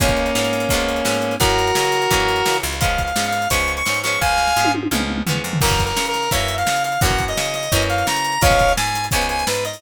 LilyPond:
<<
  \new Staff \with { instrumentName = "Lead 1 (square)" } { \time 4/4 \key des \major \tempo 4 = 171 <bes des'>1 | <ges' bes'>1 | \tuplet 3/2 { f''4 f''4 f''4 } des'''8. des'''8. des'''8 | <f'' aes''>4. r2 r8 |
\tuplet 3/2 { bes'4 bes'4 bes'4 } fes''8. f''8. f''8 | ges''8. ees''8. ees''4 f''8 bes''4 | <des'' f''>4 aes''4 aes''8 aes''8 ces''8 ees''8 | }
  \new Staff \with { instrumentName = "Acoustic Guitar (steel)" } { \time 4/4 \key des \major <f aes ces' des'>4 <f aes ces' des'>4 <f aes ces' des'>4 <f aes ces' des'>4 | <fes ges bes des'>4 <fes ges bes des'>4 <fes ges bes des'>4 <fes ges bes des'>4 | <f aes ces' des'>4 <f aes ces' des'>4 <f aes ces' des'>4 <f aes ces' des'>8 <f aes ces' des'>8~ | <f aes ces' des'>4 <f aes ces' des'>4 <f aes ces' des'>4 <f aes ces' des'>4 |
<fes ges bes des'>2 <fes ges bes des'>2 | <fes ges bes des'>2 <fes ges bes des'>2 | <f aes ces' des'>2 <f aes ces' des'>2 | }
  \new Staff \with { instrumentName = "Electric Bass (finger)" } { \clef bass \time 4/4 \key des \major des,4 aes,4 des,4 aes,4 | ges,4 des4 ges,4 des8 des,8~ | des,4 aes,4 des,4 aes,4 | des,4 aes,4 des,4 e,8 f,8 |
ges,4 des4 ges,4 des4 | ges,4 des4 ges,4 des4 | des,4 aes,4 des,4 aes,4 | }
  \new DrumStaff \with { instrumentName = "Drums" } \drummode { \time 4/4 <hh bd>16 <hh bd>16 hh16 hh16 sn16 hh16 <hh sn>16 hh16 <hh bd>16 hh16 hh16 hh16 sn16 hh16 hh16 hh16 | <hh bd>16 hh16 hh16 hh16 sn16 hh16 <hh sn>16 hh16 <hh bd>16 hh16 hh16 hh16 sn16 hh16 hh16 hh16 | <hh bd>16 hh16 <hh bd>16 hh16 sn16 hh16 <hh sn>16 hh16 <hh bd>16 hh16 hh16 hh16 sn16 hh16 hh16 hh16 | bd8 sn16 sn16 r16 tommh16 tommh16 tommh16 toml16 toml16 toml16 toml16 tomfh16 tomfh8 tomfh16 |
<cymc bd>16 <hh bd>16 <hh bd>16 hh16 sn16 hh16 <hh sn>16 hh16 <hh bd>16 hh16 hh16 hh16 sn16 hh16 hh16 hh16 | <hh bd>16 <hh bd>16 <hh bd>16 hh16 sn16 hh16 <hh sn>16 hh16 <hh bd>16 hh16 hh16 hh16 sn16 hh16 hh16 hh16 | <hh bd>16 <hh bd>16 <hh bd>16 hh16 sn16 hh16 <hh sn>16 hh16 <hh bd>16 hh16 hh16 hh16 sn16 hh16 hh16 hho16 | }
>>